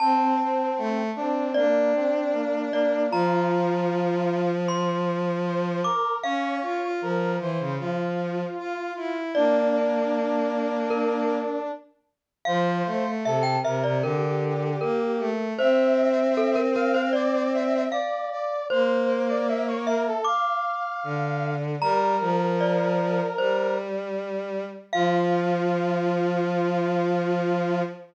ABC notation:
X:1
M:4/4
L:1/16
Q:1/4=77
K:F
V:1 name="Glockenspiel"
a8 d6 d2 | b8 c'6 d'2 | f16 | d8 B4 z4 |
f4 e g e d B4 B4 | c4 A B B c d4 f4 | c6 e2 d'8 | b4 d4 c2 z6 |
f16 |]
V:2 name="Brass Section"
C6 D2 B,2 C2 B,2 B,2 | F8 z4 c2 B2 | _d4 B2 c2 F8 | D14 z2 |
c4 A2 B2 G8 | e6 f2 d2 e2 d2 d2 | c3 d e ^c B A f8 | B12 z4 |
F16 |]
V:3 name="Violin"
C2 C2 A,2 C2 D8 | F,16 | _D2 F F F,2 E, _D, F,4 F2 E2 | B,12 z4 |
F,2 A, A, C,2 C, C, D,4 B,2 A,2 | C12 z4 | B,8 z4 D,4 | G,2 F,6 G,8 |
F,16 |]